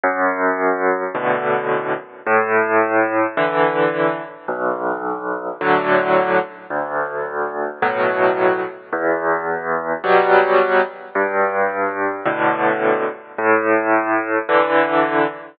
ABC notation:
X:1
M:4/4
L:1/8
Q:1/4=54
K:Bm
V:1 name="Acoustic Grand Piano" clef=bass
F,,2 [A,,B,,D,]2 | A,,2 [D,E,]2 B,,,2 [A,,D,F,]2 | D,,2 [A,,B,,F,]2 E,,2 [B,,F,G,]2 | G,,2 [A,,B,,D,]2 A,,2 [D,E,]2 |]